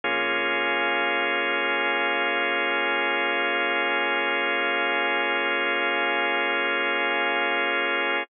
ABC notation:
X:1
M:4/4
L:1/8
Q:1/4=58
K:Bbdor
V:1 name="Synth Bass 2" clef=bass
B,,,8- | B,,,8 |]
V:2 name="Drawbar Organ"
[B,DFA]8- | [B,DFA]8 |]